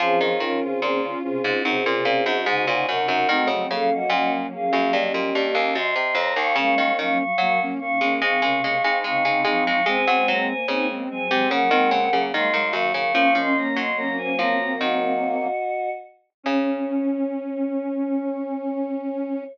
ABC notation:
X:1
M:4/4
L:1/16
Q:1/4=73
K:Db
V:1 name="Choir Aahs"
[CA]2 [DB] [CA] [CA] z [CA]2 [CA]4 [ca]2 [Bg] [Bg] | [Ge]2 [=Af] [Ge] [Ge] z [_Af]2 [=Ge]4 [ec']2 [db] [fd'] | [fd']2 [fd'] [fd'] [fd'] z [fd']2 [fd']4 [fd']2 [fd'] [fd'] | [ca]2 [db] [ca] [ca] z [ca]2 [Bg]4 [ec']2 [fd'] [fd'] |
[fd'] [ec'] [db] [ec'] [db] [ca] [db]2 [Ge]6 z2 | d16 |]
V:2 name="Ocarina"
[DF]4 [B,D] [DF] [DF] [DF] [CE] [DF]2 [EG] [EG] [EG] [EG]2 | [CE] [=A,C] [B,D] [B,D]11 z2 | [B,D]4 [G,B,] [B,D] [B,D] [B,D] [A,C] [B,D]2 [CE] [CE] [CE] [CE]2 | [A,C]4 [CE] [A,C] [A,C] [A,C] [B,D] [A,C]2 [G,B,] [G,B,] [G,B,] [G,B,]2 |
[B,D]4 [G,B,]8 z4 | D16 |]
V:3 name="Ocarina"
F,2 E,4 C,2 C, C,2 z D,2 C,2 | =A, G,11 z4 | A,2 G,4 E,2 E, C,2 z D,2 F,2 | C2 B,4 G,2 G, B,2 z A,2 E,2 |
D2 B,2 D D C C5 z4 | D16 |]
V:4 name="Pizzicato Strings" clef=bass
F, E, E, z B,,2 z A,, G,, B,, B,, G,, A,, B,, G,, G,, | E, D, D, z B,,2 z G,, =G,, B,, G,, E,, _G,, C, F,, E,, | D, E, E, z G,2 z A, A, A, A, A, A, A, A, A, | A, G, G, z D,2 z C, D, E, D, D, E, E, G,, D, |
F, F,2 G,3 F,2 E,6 z2 | D,16 |]